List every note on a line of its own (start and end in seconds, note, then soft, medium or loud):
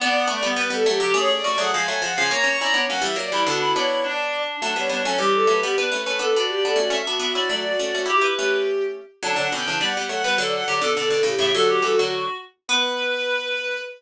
0.00 0.25 B3 medium
0.00 0.27 B3 medium
0.00 0.27 D4 medium
0.00 0.14 D5 loud
0.14 0.26 F#5 medium
0.27 0.42 A3 medium
0.27 0.40 B3 medium
0.27 0.40 D4 medium
0.27 0.43 D5 loud
0.43 0.55 G3 medium
0.43 0.55 B3 medium
0.43 0.58 B3 medium
0.56 0.69 G3 medium
0.56 0.69 B3 medium
0.56 0.69 B4 loud
0.56 0.70 B4 medium
0.70 0.84 G3 medium
0.70 0.84 B3 medium
0.70 0.84 A4 loud
0.86 0.99 F#3 medium
0.86 1.00 A3 medium
0.86 1.14 G4 loud
1.00 1.12 D3 medium
1.00 1.12 F#3 medium
1.00 1.13 G4 medium
1.14 1.41 A3 medium
1.14 1.41 C#4 medium
1.14 1.41 G#4 medium
1.14 1.29 C#5 loud
1.31 1.44 D5 loud
1.44 1.56 A3 medium
1.44 1.56 C#4 medium
1.44 1.57 F#4 medium
1.44 1.57 D5 loud
1.57 1.72 F#3 medium
1.57 1.72 A3 medium
1.57 1.71 G#4 medium
1.57 1.70 F#5 loud
1.73 1.87 F3 medium
1.73 1.87 G#3 medium
1.73 1.86 F5 medium
1.73 1.86 G#5 medium
1.87 2.02 F#3 medium
1.87 2.02 A3 medium
1.87 1.99 G#5 loud
2.02 2.14 F3 medium
2.02 2.14 G#3 medium
2.02 2.14 F#5 medium
2.16 2.31 C#3 medium
2.16 2.31 F3 medium
2.16 2.28 F5 medium
2.16 2.29 G#5 loud
2.30 2.43 A#3 medium
2.30 2.43 C#4 medium
2.30 2.58 C#5 medium
2.30 2.44 A#5 loud
2.44 2.57 A#3 medium
2.44 2.57 C#4 medium
2.44 2.58 C#6 loud
2.59 2.74 C#4 medium
2.59 2.74 E4 medium
2.59 2.72 D5 medium
2.59 2.73 A#5 loud
2.74 2.87 B3 medium
2.74 2.87 D4 medium
2.74 2.86 C#5 medium
2.88 3.03 F#3 medium
2.88 3.03 A#3 medium
2.88 3.02 C#4 medium
2.88 3.01 F#5 loud
3.02 3.16 E3 medium
3.02 3.16 G3 medium
3.02 3.16 E5 loud
3.16 3.30 F#3 medium
3.16 3.30 A#3 medium
3.16 3.41 D5 loud
3.32 3.45 E3 medium
3.32 3.45 G3 medium
3.32 3.47 E4 medium
3.46 3.74 B2 medium
3.46 3.74 D3 medium
3.46 3.59 D4 medium
3.46 3.73 F#4 loud
3.61 3.73 E4 medium
3.75 4.43 B3 medium
3.75 4.43 D4 medium
3.75 3.99 E4 medium
3.75 4.02 C#5 medium
4.03 4.56 D4 medium
4.03 4.38 D5 loud
4.61 4.74 F#3 medium
4.61 4.74 A3 medium
4.61 4.84 D4 medium
4.76 4.89 G3 medium
4.76 4.89 B3 medium
4.76 4.89 C#5 medium
4.89 5.02 G3 medium
4.89 5.02 B3 medium
4.89 5.03 D4 medium
4.89 5.01 C#5 medium
5.04 5.17 F#3 medium
5.04 5.17 A3 medium
5.04 5.18 C#4 medium
5.04 5.17 C#5 medium
5.18 5.44 E3 medium
5.18 5.44 G3 medium
5.18 5.72 G4 medium
5.18 5.32 G4 loud
5.33 5.45 A4 loud
5.47 5.60 F#3 medium
5.47 5.60 A3 medium
5.47 5.60 B4 medium
5.63 5.77 G3 medium
5.63 5.77 B3 medium
5.63 5.75 G4 loud
5.77 5.90 B3 medium
5.77 5.90 D4 medium
5.77 6.01 B4 medium
5.91 6.04 A3 medium
5.91 6.04 C#4 medium
5.91 6.04 B4 medium
6.06 6.20 A3 medium
6.06 6.20 C#4 medium
6.06 6.19 B4 loud
6.06 6.18 B4 medium
6.19 6.31 B3 medium
6.19 6.31 D4 medium
6.19 6.34 A4 medium
6.19 6.33 B4 medium
6.34 6.64 B3 medium
6.34 6.64 D4 medium
6.34 6.48 F#4 medium
6.34 6.91 D5 medium
6.48 6.62 G4 loud
6.64 6.79 B3 medium
6.64 6.79 D4 medium
6.64 6.76 A4 medium
6.76 6.90 A3 medium
6.76 6.90 C#4 medium
6.76 6.91 F#4 medium
6.90 7.02 A3 medium
6.90 7.02 C#4 medium
6.90 7.17 E5 medium
7.07 7.19 B3 medium
7.07 7.19 D4 medium
7.07 7.20 F#4 medium
7.19 7.33 B3 medium
7.19 7.33 D4 medium
7.19 7.33 F#4 loud
7.19 7.33 E5 medium
7.35 7.49 C#4 medium
7.35 7.49 E4 medium
7.35 7.48 F#4 loud
7.35 7.48 D5 medium
7.49 7.73 F#3 medium
7.49 7.73 A3 medium
7.49 7.62 F#4 medium
7.49 7.98 D5 medium
7.64 7.78 F#4 loud
7.79 7.92 A3 medium
7.79 7.92 C#4 medium
7.79 7.93 F#4 medium
7.94 8.07 A3 soft
7.94 8.07 C#4 medium
7.94 8.06 F#4 loud
8.06 8.18 E4 medium
8.06 8.18 G4 medium
8.06 8.20 G4 loud
8.06 8.22 G4 medium
8.21 8.34 E4 medium
8.21 8.34 G4 medium
8.21 8.58 B4 medium
8.35 9.01 A3 medium
8.35 9.01 C#4 medium
8.35 8.83 G4 medium
9.23 9.35 D3 medium
9.23 9.35 F#3 medium
9.23 9.51 D4 medium
9.23 9.36 D5 loud
9.36 9.48 D3 medium
9.36 9.48 F#3 medium
9.36 9.49 F#5 medium
9.51 9.66 B2 medium
9.51 9.66 D3 medium
9.51 9.64 C#4 medium
9.51 9.79 G5 medium
9.66 9.81 C#3 medium
9.66 9.81 E3 medium
9.66 9.78 D4 medium
9.80 9.94 G3 medium
9.80 9.94 B3 medium
9.80 9.94 D5 medium
9.80 10.05 F#5 medium
9.97 10.10 G3 medium
9.97 10.10 B3 medium
10.09 10.23 F#3 medium
10.09 10.23 A3 medium
10.09 10.36 F#5 loud
10.24 10.38 G3 medium
10.24 10.38 B3 medium
10.24 10.38 B4 medium
10.38 10.61 D3 medium
10.38 10.61 F#3 medium
10.38 10.62 A4 medium
10.38 10.51 D5 loud
10.53 10.65 F#5 medium
10.67 10.81 D3 medium
10.67 10.81 F#3 medium
10.67 10.79 G4 medium
10.67 10.82 D5 medium
10.81 10.94 B2 medium
10.81 10.94 D3 medium
10.81 10.96 A4 medium
10.95 11.09 B2 medium
10.95 11.09 D3 medium
10.95 11.09 A4 medium
10.95 11.09 D5 medium
11.10 11.22 B2 medium
11.10 11.22 D3 medium
11.10 11.23 A4 medium
11.23 11.35 A2 medium
11.23 11.35 C#3 medium
11.23 11.50 G4 medium
11.39 11.52 A2 medium
11.39 11.52 C#3 medium
11.39 11.53 E5 medium
11.53 11.82 D3 medium
11.53 11.82 F#3 medium
11.53 12.09 F#4 loud
11.53 11.67 A4 medium
11.69 11.82 G4 medium
11.82 11.96 E3 medium
11.82 11.96 G3 medium
11.82 11.96 A4 medium
11.97 12.26 D3 medium
11.97 12.26 F#3 medium
11.97 12.34 F#4 medium
12.68 13.77 B3 loud
12.68 13.76 B4 loud
12.68 13.77 B4 loud